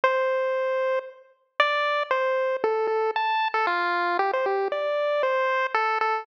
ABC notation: X:1
M:6/8
L:1/16
Q:3/8=77
K:C
V:1 name="Lead 1 (square)"
c8 z4 | [K:F] d4 c4 A2 A2 | a3 A F4 G c G2 | d4 c4 A2 A2 |]